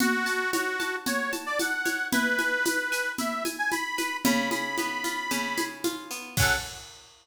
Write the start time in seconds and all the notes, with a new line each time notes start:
0.00 F#4, low conga, shaker
0.26 A5, shaker
0.53 F#4 C#5, high conga, shaker
0.80 A5, high conga, shaker
1.06 F#4 C#5, low conga, shaker
1.32 A5, high conga, shaker
1.46 D5
1.59 F#5 A5, high conga, shaker
1.85 C#5, high conga, shaker
2.12 E4 B4, low conga, shaker
2.39 G#5, high conga, shaker
2.65 B4, high conga, shaker
2.92 G#5, shaker
3.18 E4 E5, low conga, shaker
3.45 G#5, high conga, shaker
3.59 G#5
3.71 G#5 B5, high conga, shaker
3.98 B4, high conga, shaker
4.25 C#3 B5, low conga, shaker
4.51 G#4 B5, high conga, shaker
4.78 B3, high conga, shaker
5.04 F4, high conga, shaker
5.31 C#3, low conga, shaker
5.58 G#4, high conga, shaker
5.84 F4, high conga, shaker
6.11 B3, shaker
6.37 F#3 C#4 F#5, kick, crash
6.42 A4